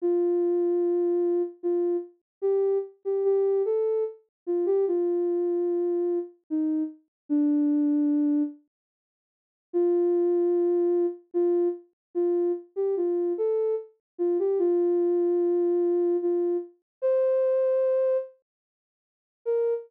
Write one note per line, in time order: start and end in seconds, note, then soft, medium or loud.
0.02 1.42 F4 loud
1.63 1.97 F4 loud
2.42 2.78 G4 loud
3.05 3.24 G4 medium
3.24 3.62 G4 loud
3.65 4.04 A4 loud
4.46 4.66 F4 medium
4.66 4.85 G4 loud
4.88 6.19 F4 loud
6.50 6.83 D#4 medium
7.29 8.43 D4 loud
9.73 11.06 F4 loud
11.34 11.68 F4 loud
12.15 12.52 F4 loud
12.76 12.95 G4 medium
12.97 13.33 F4 medium
13.38 13.75 A4 loud
14.18 14.38 F4 loud
14.39 14.58 G4 loud
14.59 16.17 F4 loud
16.22 16.57 F4 loud
17.02 18.17 C5 loud
19.45 19.74 A#4 loud